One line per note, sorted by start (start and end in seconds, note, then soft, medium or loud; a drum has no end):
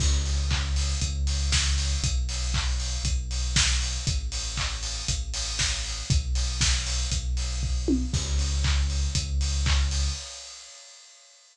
0.00 0.94 C#2 loud
0.00 kick loud
0.00 crash loud
0.26 open hi-hat medium
0.51 kick medium
0.51 clap loud
0.76 open hi-hat medium
1.01 1.95 C#2 loud
1.01 kick medium
1.01 closed hi-hat loud
1.27 open hi-hat medium
1.52 kick medium
1.52 snare loud
1.78 open hi-hat medium
2.03 2.97 B1 loud
2.03 kick loud
2.03 closed hi-hat loud
2.29 open hi-hat medium
2.54 kick medium
2.54 clap loud
2.80 open hi-hat medium
3.04 3.97 B1 loud
3.04 kick medium
3.04 closed hi-hat loud
3.31 open hi-hat medium
3.56 kick loud
3.56 snare loud
3.81 open hi-hat medium
4.07 5.02 A1 loud
4.07 kick loud
4.07 closed hi-hat loud
4.32 open hi-hat medium
4.57 kick medium
4.57 clap loud
4.83 open hi-hat medium
5.08 6.02 A1 medium
5.08 kick medium
5.08 closed hi-hat loud
5.34 open hi-hat loud
5.59 kick medium
5.59 snare loud
5.85 open hi-hat medium
6.10 7.05 B1 loud
6.10 kick loud
6.10 closed hi-hat loud
6.35 open hi-hat medium
6.61 kick loud
6.61 snare loud
6.87 open hi-hat medium
7.11 8.05 B1 loud
7.11 kick medium
7.11 closed hi-hat loud
7.37 open hi-hat medium
7.63 kick medium
7.88 high tom loud
8.13 9.07 C#2 loud
8.13 kick loud
8.13 crash loud
8.39 open hi-hat medium
8.64 kick medium
8.64 clap loud
8.90 open hi-hat medium
9.15 10.09 C#2 medium
9.15 kick loud
9.15 closed hi-hat loud
9.41 open hi-hat medium
9.66 kick loud
9.66 clap loud
9.91 open hi-hat medium